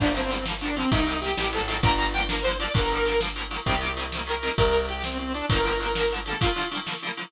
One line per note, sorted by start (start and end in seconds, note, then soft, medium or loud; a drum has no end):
0.00 0.84 G1 medium
0.00 0.07 D3 medium
0.00 0.07 F3 medium
0.00 0.12 D4 loud
0.00 kick loud
0.00 crash loud
0.05 0.08 G3 medium
0.05 0.10 A#3 medium
0.15 0.21 D3 medium
0.15 0.21 F3 medium
0.15 0.21 G3 medium
0.15 0.31 C4 loud
0.15 ride medium
0.20 0.23 A#3 medium
0.30 0.36 D3 medium
0.30 0.36 F3 medium
0.30 0.36 G3 medium
0.30 0.45 C4 medium
0.30 ride medium
0.35 0.38 A#3 medium
0.46 0.52 D3 medium
0.46 0.52 F3 medium
0.46 snare loud
0.50 0.53 G3 medium
0.50 0.55 A#3 medium
0.61 0.68 D3 medium
0.61 0.68 F3 medium
0.61 0.76 D4 medium
0.61 ride medium
0.66 0.69 G3 medium
0.66 0.70 A#3 medium
0.76 0.83 D3 medium
0.76 0.83 F3 medium
0.76 0.91 C4 loud
0.76 ride medium
0.80 0.83 G3 medium
0.80 0.85 A#3 medium
0.91 1.35 C2 medium
0.91 0.98 C3 medium
0.91 0.98 D#3 medium
0.91 1.19 D#4 loud
0.91 kick loud
0.91 ride loud
0.95 0.98 G3 medium
0.95 1.00 A#3 medium
1.07 1.13 C3 medium
1.07 1.13 D#3 medium
1.07 1.14 G3 medium
1.07 ride medium
1.13 1.16 A#3 medium
1.21 1.28 C3 medium
1.21 1.28 D#3 medium
1.21 1.50 G4 medium
1.21 ride medium
1.26 1.29 G3 medium
1.26 1.31 A#3 medium
1.37 1.58 A1 medium
1.37 1.44 C3 medium
1.37 1.44 D#3 medium
1.37 snare loud
1.42 1.45 G3 medium
1.42 1.47 A#3 medium
1.53 1.59 C3 medium
1.53 1.59 D#3 medium
1.53 1.60 G3 medium
1.53 1.78 A4 medium
1.53 ride medium
1.58 1.81 G#1 medium
1.58 1.61 A#3 medium
1.68 1.74 C3 medium
1.68 1.74 D#3 medium
1.68 ride medium
1.72 1.75 G3 medium
1.72 1.77 A#3 medium
1.83 2.67 G1 medium
1.83 1.89 D3 medium
1.83 1.89 F3 medium
1.83 1.90 G3 medium
1.83 2.10 A#5 loud
1.83 kick loud
1.83 ride loud
1.88 1.91 A#3 medium
1.98 2.04 D3 medium
1.98 2.04 F3 medium
1.98 2.05 G3 medium
1.98 ride medium
2.04 2.07 A#3 medium
2.13 2.20 D3 medium
2.13 2.20 F3 medium
2.13 2.27 G5 loud
2.13 ride medium
2.18 2.21 G3 medium
2.18 2.23 A#3 medium
2.29 2.35 D3 medium
2.29 2.35 F3 medium
2.29 2.36 G3 medium
2.29 2.43 A#4 medium
2.29 snare loud
2.34 2.37 A#3 medium
2.43 2.51 D3 medium
2.43 2.57 C5 loud
2.43 ride medium
2.47 2.51 F3 medium
2.47 2.52 G3 medium
2.47 2.53 A#3 medium
2.60 2.66 D3 medium
2.60 2.66 F3 medium
2.60 2.66 G3 medium
2.60 2.72 D5 loud
2.60 ride medium
2.65 2.68 A#3 medium
2.74 3.59 G1 medium
2.74 2.80 D3 medium
2.74 2.80 F3 medium
2.74 2.81 G3 medium
2.74 3.20 A#4 loud
2.74 kick loud
2.74 ride loud
2.80 2.83 A#3 medium
2.90 2.98 D3 medium
2.90 2.98 F3 medium
2.90 ride medium
2.95 2.98 G3 medium
2.95 3.00 A#3 medium
3.05 3.12 D3 medium
3.05 3.12 F3 medium
3.05 ride medium
3.10 3.13 G3 medium
3.10 3.15 A#3 medium
3.20 3.26 D3 medium
3.20 3.26 F3 medium
3.20 3.27 G3 medium
3.20 snare loud
3.26 3.29 A#3 medium
3.36 3.42 D3 medium
3.36 3.42 F3 medium
3.36 3.43 G3 medium
3.36 ride medium
3.42 3.45 A#3 medium
3.51 3.57 D3 medium
3.51 3.57 F3 medium
3.51 3.57 G3 medium
3.51 ride medium
3.56 3.59 A#3 medium
3.66 4.51 C2 medium
3.66 3.73 C3 medium
3.66 3.73 D#3 medium
3.66 3.92 G4 loud
3.66 kick medium
3.66 ride loud
3.71 3.74 G3 medium
3.71 3.76 A#3 medium
3.81 3.87 C3 medium
3.81 3.87 D#3 medium
3.81 3.88 G3 medium
3.81 ride medium
3.86 3.89 A#3 medium
3.97 4.04 C3 medium
3.97 4.04 D#3 medium
3.97 ride medium
4.01 4.04 G3 medium
4.01 4.06 A#3 medium
4.12 4.19 C3 medium
4.12 4.19 D#3 medium
4.12 snare loud
4.17 4.20 G3 medium
4.17 4.22 A#3 medium
4.27 4.33 C3 medium
4.27 4.33 D#3 medium
4.27 4.33 G3 medium
4.27 4.54 A#4 medium
4.27 ride medium
4.32 4.35 A#3 medium
4.43 4.49 C3 medium
4.43 4.49 D#3 medium
4.43 ride medium
4.47 4.50 G3 medium
4.47 4.52 A#3 medium
4.57 5.42 C2 medium
4.57 4.86 A#4 loud
4.57 kick loud
4.57 ride loud
4.73 ride medium
4.89 5.02 G4 medium
4.89 ride medium
5.04 5.18 C4 medium
5.04 snare loud
5.19 5.33 C4 medium
5.19 ride medium
5.34 5.46 D4 loud
5.34 ride medium
5.49 6.34 G1 medium
5.49 5.56 D3 medium
5.49 5.56 F3 medium
5.49 6.13 A#4 loud
5.49 kick loud
5.49 ride loud
5.54 5.57 G3 medium
5.54 5.59 A#3 medium
5.64 5.70 D3 medium
5.64 5.70 F3 medium
5.64 5.71 G3 medium
5.64 ride medium
5.70 5.73 A#3 medium
5.80 5.87 D3 medium
5.80 5.87 F3 medium
5.80 ride medium
5.84 5.87 G3 medium
5.84 5.89 A#3 medium
5.95 6.02 D3 medium
5.95 6.02 F3 medium
5.95 snare loud
6.00 6.03 G3 medium
6.00 6.05 A#3 medium
6.11 6.19 D3 medium
6.11 6.19 F3 medium
6.11 ride medium
6.16 6.19 G3 medium
6.16 6.21 A#3 medium
6.26 6.33 D3 medium
6.26 6.33 F3 medium
6.26 6.39 A4 medium
6.26 ride medium
6.31 6.34 G3 medium
6.31 6.36 A#3 medium
6.41 6.47 D3 medium
6.41 6.47 F3 medium
6.41 6.47 G3 medium
6.41 6.68 F4 loud
6.41 kick loud
6.41 ride loud
6.46 6.49 A#3 medium
6.56 6.62 D3 medium
6.56 6.62 F3 medium
6.56 6.63 G3 medium
6.56 ride medium
6.62 6.65 A#3 medium
6.71 6.78 D3 medium
6.71 6.78 F3 medium
6.71 6.78 G3 medium
6.71 ride medium
6.77 6.80 A#3 medium
6.86 6.92 D3 medium
6.86 6.92 F3 medium
6.86 6.93 G3 medium
6.86 snare loud
6.92 6.95 A#3 medium
7.02 7.09 D3 medium
7.02 7.09 F3 medium
7.02 ride medium
7.07 7.10 G3 medium
7.07 7.12 A#3 medium
7.17 7.23 D3 medium
7.17 7.23 F3 medium
7.17 7.24 G3 medium
7.17 ride medium
7.23 7.26 A#3 medium